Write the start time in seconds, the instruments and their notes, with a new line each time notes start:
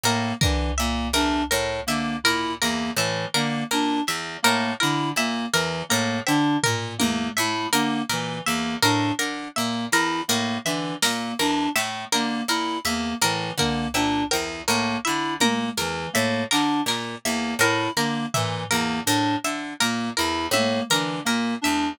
0.04 orchestral harp A2, clarinet A#3, harpsichord A#4
0.41 orchestral harp D3, clarinet E3, harpsichord A#4, kick
0.78 orchestral harp A#2, clarinet A#3, harpsichord E5
1.13 orchestral harp E2, clarinet D4, harpsichord A#4
1.51 orchestral harp A2, harpsichord A#4
1.87 orchestral harp D3, clarinet A#3, harpsichord E5
2.24 orchestral harp A#2, clarinet E4, harpsichord A#4, floor tom
2.61 orchestral harp E2, clarinet A#3, harpsichord A#4
2.96 orchestral harp A2, clarinet E3, harpsichord E5
3.34 orchestral harp D3, clarinet A#3, harpsichord A#4
3.71 orchestral harp A#2, clarinet D4, harpsichord A#4
4.07 orchestral harp E2, harpsichord E5, clap
4.43 orchestral harp A2, clarinet A#3, harpsichord A#4
4.80 orchestral harp D3, clarinet E4, harpsichord A#4
5.16 orchestral harp A#2, clarinet A#3, harpsichord E5
5.53 orchestral harp E2, clarinet E3, harpsichord A#4
5.89 orchestral harp A2, clarinet A#3, harpsichord A#4
6.27 orchestral harp D3, clarinet D4, harpsichord E5, cowbell
6.63 orchestral harp A#2, harpsichord A#4, floor tom
6.98 orchestral harp E2, clarinet A#3, harpsichord A#4, high tom
7.37 orchestral harp A2, clarinet E4, harpsichord E5
7.73 orchestral harp D3, clarinet A#3, harpsichord A#4, closed hi-hat
8.09 orchestral harp A#2, clarinet E3, harpsichord A#4
8.46 orchestral harp E2, clarinet A#3, harpsichord E5
8.82 orchestral harp A2, clarinet D4, harpsichord A#4
9.19 orchestral harp D3, harpsichord A#4
9.56 orchestral harp A#2, clarinet A#3, harpsichord E5
9.92 orchestral harp E2, clarinet E4, harpsichord A#4
10.28 orchestral harp A2, clarinet A#3, harpsichord A#4
10.65 orchestral harp D3, clarinet E3, harpsichord E5
11.02 orchestral harp A#2, clarinet A#3, harpsichord A#4, snare
11.39 orchestral harp E2, clarinet D4, harpsichord A#4
11.76 orchestral harp A2, harpsichord E5, clap
12.12 orchestral harp D3, clarinet A#3, harpsichord A#4
12.48 orchestral harp A#2, clarinet E4, harpsichord A#4, closed hi-hat
12.85 orchestral harp E2, clarinet A#3, harpsichord E5
13.21 orchestral harp A2, clarinet E3, harpsichord A#4
13.58 orchestral harp D3, clarinet A#3, harpsichord A#4, kick
13.94 orchestral harp A#2, clarinet D4, harpsichord E5, cowbell
14.31 orchestral harp E2, harpsichord A#4, cowbell
14.68 orchestral harp A2, clarinet A#3, harpsichord A#4, closed hi-hat
15.05 orchestral harp D3, clarinet E4, harpsichord E5
15.40 orchestral harp A#2, clarinet A#3, harpsichord A#4, high tom
15.77 orchestral harp E2, clarinet E3, harpsichord A#4
16.13 orchestral harp A2, clarinet A#3, harpsichord E5
16.51 orchestral harp D3, clarinet D4, harpsichord A#4, clap
16.86 orchestral harp A#2, harpsichord A#4, clap
17.25 orchestral harp E2, clarinet A#3, harpsichord E5
17.59 orchestral harp A2, clarinet E4, harpsichord A#4, cowbell
17.97 orchestral harp D3, clarinet A#3, harpsichord A#4
18.34 orchestral harp A#2, clarinet E3, harpsichord E5, floor tom
18.70 orchestral harp E2, clarinet A#3, harpsichord A#4
19.06 orchestral harp A2, clarinet D4, harpsichord A#4, closed hi-hat
19.44 orchestral harp D3, harpsichord E5
19.80 orchestral harp A#2, clarinet A#3, harpsichord A#4, closed hi-hat
20.17 orchestral harp E2, clarinet E4, harpsichord A#4
20.51 orchestral harp A2, clarinet A#3, harpsichord E5, high tom
20.90 orchestral harp D3, clarinet E3, harpsichord A#4, closed hi-hat
21.25 orchestral harp A#2, clarinet A#3, harpsichord A#4
21.62 orchestral harp E2, clarinet D4, harpsichord E5, high tom